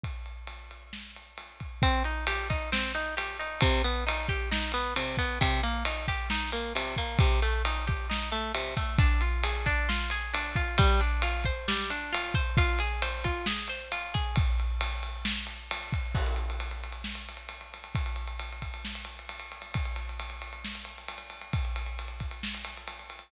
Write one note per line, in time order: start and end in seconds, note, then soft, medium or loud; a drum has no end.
0.03 kick medium
0.03 ride medium
0.26 ride medium
0.47 ride medium
0.71 ride medium
0.93 snare medium
1.16 ride medium
1.38 ride medium
1.60 kick medium
1.60 ride medium
1.82 2.03 C4 loud
1.82 kick loud
1.82 ride loud
2.04 2.25 D#4 medium
2.04 ride medium
2.27 2.48 G4 medium
2.27 ride loud
2.50 2.70 D#4 medium
2.50 kick loud
2.50 ride medium
2.72 2.92 C4 loud
2.72 snare loud
2.95 3.15 D#4 medium
2.95 ride medium
3.17 3.37 G4 medium
3.17 ride loud
3.39 3.60 D#4 medium
3.39 ride medium
3.61 3.82 C3 loud
3.61 kick loud
3.61 ride loud
3.84 4.04 B3 medium
3.84 ride medium
4.07 4.27 D#4 medium
4.07 ride loud
4.29 4.49 G4 medium
4.29 kick loud
4.29 ride medium
4.51 4.72 D#4 medium
4.51 snare loud
4.72 4.94 B3 medium
4.72 ride medium
4.96 5.16 C3 medium
4.96 ride loud
5.17 5.39 B3 medium
5.17 kick loud
5.17 ride medium
5.41 5.61 C3 loud
5.41 kick loud
5.41 ride loud
5.63 5.83 A#3 medium
5.63 ride medium
5.85 6.06 D#4 medium
5.85 ride loud
6.08 6.28 G4 medium
6.08 kick medium
6.08 ride medium
6.30 6.51 D#4 medium
6.30 snare loud
6.52 6.73 A#3 medium
6.52 ride medium
6.75 6.95 C3 medium
6.75 ride loud
6.96 7.18 A#3 medium
6.96 kick medium
6.96 ride medium
7.19 7.40 C3 medium
7.19 kick loud
7.19 ride loud
7.42 7.62 A3 medium
7.42 ride medium
7.65 7.85 D#4 medium
7.65 ride loud
7.87 8.07 G4 medium
7.87 kick loud
7.87 ride medium
8.10 8.30 D#4 medium
8.10 snare loud
8.32 8.52 A3 medium
8.32 ride medium
8.54 8.75 C3 medium
8.54 ride loud
8.77 8.97 A3 medium
8.77 kick loud
8.77 ride medium
8.98 9.22 D4 medium
8.98 kick loud
8.98 ride loud
9.21 9.44 F4 medium
9.21 ride medium
9.43 9.66 G#4 medium
9.43 ride loud
9.66 9.89 D4 medium
9.66 kick loud
9.66 ride medium
9.89 10.11 F4 medium
9.89 snare loud
10.10 10.33 G#4 medium
10.10 ride medium
10.34 10.56 D4 medium
10.34 ride loud
10.56 10.77 F4 medium
10.56 kick loud
10.56 ride medium
10.78 11.01 G3 loud
10.78 kick loud
10.78 ride loud
11.00 11.23 D4 medium
11.00 ride medium
11.22 11.45 F4 medium
11.22 ride loud
11.44 11.68 C5 medium
11.44 kick medium
11.44 ride medium
11.68 11.90 G3 medium
11.68 snare loud
11.90 12.13 D4 medium
11.90 ride loud
12.13 12.35 F4 medium
12.13 ride loud
12.34 12.56 C5 medium
12.34 kick loud
12.34 ride medium
12.57 12.80 F4 loud
12.57 kick loud
12.57 ride loud
12.79 13.02 G#4 medium
12.79 ride medium
13.02 13.25 C5 medium
13.02 ride loud
13.24 13.47 F4 medium
13.24 kick medium
13.24 ride medium
13.46 13.69 G#4 medium
13.46 snare loud
13.68 13.92 C5 medium
13.68 ride medium
13.92 14.14 F4 medium
13.92 ride loud
14.14 14.35 G#4 medium
14.14 kick loud
14.14 ride medium
14.36 kick loud
14.36 ride loud
14.60 ride medium
14.81 ride loud
15.03 ride medium
15.25 snare loud
15.47 ride medium
15.71 ride loud
15.93 kick loud
15.93 ride medium
16.14 kick loud
16.14 crash loud
16.26 ride medium
16.36 ride medium
16.50 ride medium
16.60 ride loud
16.71 ride medium
16.84 ride medium
16.92 ride medium
17.04 snare loud
17.15 ride medium
17.29 ride medium
17.37 ride medium
17.49 ride medium
17.61 ride medium
17.74 ride medium
17.84 ride medium
17.95 kick loud
17.95 ride loud
18.06 ride medium
18.16 ride medium
18.28 ride medium
18.39 ride loud
18.53 ride medium
18.62 kick medium
18.62 ride medium
18.74 ride medium
18.85 snare loud
18.95 ride medium
19.05 ride medium
19.19 ride medium
19.29 ride loud
19.40 ride medium
19.52 ride medium
19.62 ride medium
19.74 kick loud
19.74 ride loud
19.85 ride medium
19.96 ride medium
20.09 ride medium
20.20 ride loud
20.30 ride medium
20.42 ride medium
20.53 ride medium
20.65 snare loud
20.75 ride medium
20.85 ride medium
20.98 ride medium
21.08 ride loud
21.18 ride medium
21.30 ride medium
21.41 ride medium
21.53 kick loud
21.53 ride loud
21.65 ride medium
21.76 ride medium
21.86 ride medium
21.99 ride medium
22.08 ride medium
22.20 kick medium
22.20 ride medium
22.31 ride medium
22.43 snare loud
22.54 ride medium
22.65 ride medium
22.77 ride medium
22.88 ride loud
22.99 ride medium
23.10 ride medium
23.19 ride medium